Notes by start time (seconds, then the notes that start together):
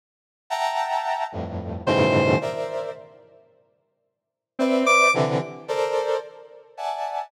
0.50 E5 F#5 G5 A5 A#5
1.32 F2 G2 A2
1.86 G2 A2 B2 C#3 D#3 E3 C5
2.41 A#4 C5 D5 E5
4.59 C4 B4 C5 D5 E5
4.86 D6
5.14 C3 D3 E3
5.68 A4 A#4 C5 D5
6.77 D5 E5 F#5 G#5 A5